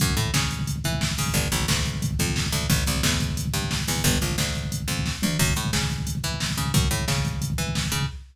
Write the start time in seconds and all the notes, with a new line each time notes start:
0.00 F#2, kick, closed hi-hat
0.08 kick
0.17 A2, kick, closed hi-hat
0.25 kick
0.34 C#3, kick, snare
0.42 kick
0.51 kick, closed hi-hat
0.59 kick
0.67 kick, closed hi-hat
0.76 kick
0.84 E3, kick, closed hi-hat
0.93 kick
1.01 kick, snare
1.10 kick
1.18 C#3, kick, open hi-hat
1.26 kick
1.34 G1, kick, closed hi-hat
1.43 kick
1.52 A#1, kick, closed hi-hat
1.60 kick
1.68 D2, kick, snare
1.77 kick
1.85 kick, closed hi-hat
1.94 kick
2.02 kick, closed hi-hat
2.11 kick
2.19 F2, kick, closed hi-hat
2.28 kick
2.36 kick, snare
2.44 kick
2.52 D2, kick, closed hi-hat
2.61 kick
2.70 A1, kick, closed hi-hat
2.78 kick
2.87 C2, kick, closed hi-hat
2.95 kick
3.03 E2, kick, snare
3.12 kick
3.20 kick, closed hi-hat
3.29 kick
3.37 kick, closed hi-hat
3.46 kick
3.54 G2, kick, closed hi-hat
3.62 kick
3.71 kick, snare
3.79 kick
3.88 E2, kick, open hi-hat
3.96 kick
4.04 G1, kick, closed hi-hat
4.13 kick
4.21 A#1, kick, closed hi-hat
4.30 kick
4.38 D2, kick, snare
4.47 kick
4.55 kick, closed hi-hat
4.63 kick
4.72 kick, closed hi-hat
4.80 kick
4.88 F2, kick, closed hi-hat
4.97 kick
5.06 kick, snare
5.22 D2, mid tom
5.39 F#2, kick, crash
5.48 kick
5.56 A2, kick, closed hi-hat
5.65 kick
5.73 C#3, kick, snare
5.81 kick
5.90 kick, closed hi-hat
5.98 kick
6.07 kick, closed hi-hat
6.15 kick
6.24 E3, kick, closed hi-hat
6.32 kick
6.40 kick, snare
6.49 kick
6.57 C#3, kick, closed hi-hat
6.66 kick
6.74 F#2, kick, closed hi-hat
6.83 kick
6.91 A2, kick, closed hi-hat
6.99 kick
7.08 C#3, kick, snare
7.16 kick
7.25 kick, closed hi-hat
7.33 kick
7.42 kick, closed hi-hat
7.50 kick
7.58 E3, kick, closed hi-hat
7.67 kick
7.75 kick, snare
7.84 kick
7.92 C#3, kick, closed hi-hat
8.01 kick